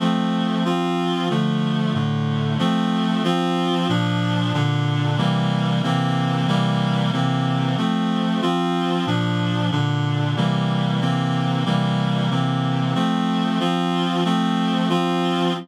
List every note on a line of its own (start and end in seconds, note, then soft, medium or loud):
0.00 0.64 F3 medium
0.00 0.64 A3 medium
0.00 0.64 C4 medium
0.65 1.29 F3 medium
0.65 1.29 C4 medium
0.65 1.29 F4 medium
1.30 1.94 D3 medium
1.30 1.94 F3 medium
1.30 1.94 A3 medium
1.94 2.58 A2 medium
1.94 2.58 D3 medium
1.94 2.58 A3 medium
2.59 3.23 F3 medium
2.59 3.23 A3 medium
2.59 3.23 C4 medium
3.24 3.88 F3 medium
3.24 3.88 C4 medium
3.24 3.88 F4 medium
3.89 4.53 A#2 medium
3.89 4.53 F3 medium
3.89 4.53 D4 medium
4.54 5.18 A#2 medium
4.54 5.18 D3 medium
4.54 5.18 D4 medium
5.18 5.82 C3 medium
5.18 5.82 E3 medium
5.18 5.82 G3 medium
5.18 5.82 A#3 medium
5.83 6.47 C3 medium
5.83 6.47 E3 medium
5.83 6.47 A#3 medium
5.83 6.47 C4 medium
6.47 7.12 C3 medium
6.47 7.12 E3 medium
6.47 7.12 G3 medium
6.47 7.12 A#3 medium
7.13 7.77 C3 medium
7.13 7.77 E3 medium
7.13 7.77 A#3 medium
7.13 7.77 C4 medium
7.77 8.41 F3 medium
7.77 8.41 A3 medium
7.77 8.41 C4 medium
8.42 9.06 F3 medium
8.42 9.06 C4 medium
8.42 9.06 F4 medium
9.07 9.71 A#2 medium
9.07 9.71 F3 medium
9.07 9.71 D4 medium
9.71 10.36 A#2 medium
9.71 10.36 D3 medium
9.71 10.36 D4 medium
10.36 11.00 C3 medium
10.36 11.00 E3 medium
10.36 11.01 G3 medium
10.36 11.00 A#3 medium
11.01 11.65 C3 medium
11.01 11.65 E3 medium
11.01 11.65 A#3 medium
11.01 11.65 C4 medium
11.65 12.30 C3 medium
11.65 12.30 E3 medium
11.65 12.30 G3 medium
11.65 12.30 A#3 medium
12.30 12.95 C3 medium
12.30 12.95 E3 medium
12.30 12.95 A#3 medium
12.30 12.94 C4 medium
12.95 13.59 F3 medium
12.95 13.59 A3 medium
12.95 13.59 C4 medium
13.60 14.24 F3 medium
13.60 14.24 C4 medium
13.60 14.24 F4 medium
14.25 14.89 F3 medium
14.25 14.89 A3 medium
14.25 14.89 C4 medium
14.89 15.53 F3 medium
14.89 15.53 C4 medium
14.89 15.53 F4 medium